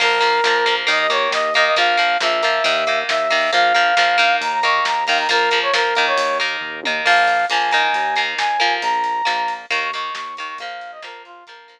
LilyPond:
<<
  \new Staff \with { instrumentName = "Brass Section" } { \time 4/4 \key bes \dorian \tempo 4 = 136 bes'2 ees''16 ees''16 des''8 ees''8 ees''16 ees''16 | f''4 e''2 e''4 | f''2 bes''16 bes''16 des'''8 bes''8 f''16 bes''16 | bes'8. des''16 bes'8. des''8. r4. |
f''4 aes''2 aes''4 | bes''2 des'''16 des'''16 des'''8 des'''8 des'''16 des'''16 | f''8. ees''16 bes'8 f'8 bes'4. r8 | }
  \new Staff \with { instrumentName = "Acoustic Guitar (steel)" } { \time 4/4 \key bes \dorian <f bes>8 <f bes>8 <f bes>8 <f bes>8 <ees bes>8 <ees bes>4 <ees bes>8 | <f bes>8 <f bes>8 <f bes>8 <f bes>8 <ees bes>8 <ees bes>4 <ees bes>8 | <f bes>8 <f bes>8 <f bes>8 <ees bes>4 <ees bes>4 <ees bes>8 | <f bes>8 <f bes>8 <f bes>8 <ees bes>4 <ees bes>4 <ees bes>8 |
<f bes>4 <f bes>8 <ees bes>4 <ees bes>4 <f bes>8~ | <f bes>4 <f bes>4 <ees bes>8 <ees bes>4 <ees bes>8 | <f bes>4 <f bes>4 <f bes>8 <f bes>4 r8 | }
  \new Staff \with { instrumentName = "Synth Bass 1" } { \clef bass \time 4/4 \key bes \dorian bes,,4 bes,,4 ees,4 ees,4 | bes,,4 bes,,4 ees,4 ees,4 | bes,,4 bes,,4 ees,4 ees,4 | bes,,4 bes,,4 ees,4 ees,4 |
bes,,4 bes,,4 ees,4 ees,4 | bes,,4 bes,,4 ees,4 ees,4 | bes,,4 bes,,4 bes,,4 r4 | }
  \new DrumStaff \with { instrumentName = "Drums" } \drummode { \time 4/4 <cymc bd>8 hh8 sn8 hh8 <hh bd>8 hh8 sn8 <hh bd>8 | <hh bd>8 hh8 sn8 hh8 <hh bd>8 hh8 sn8 <hho bd>8 | <hh bd>8 hh8 sn8 hh8 <hh bd>8 <hh bd>8 sn8 <hho bd>8 | <hh bd>8 hh8 sn8 hh8 <hh bd>8 hh8 <bd tomfh>8 tommh8 |
<cymc bd>8 hh8 hh8 hh8 <hh bd>8 <hh bd>8 sn8 hh8 | <hh bd>8 hh8 sn8 hh8 <hh bd>8 hh8 sn8 <hh bd>8 | <hh bd>8 hh8 sn8 hh8 <hh bd>8 hh8 r4 | }
>>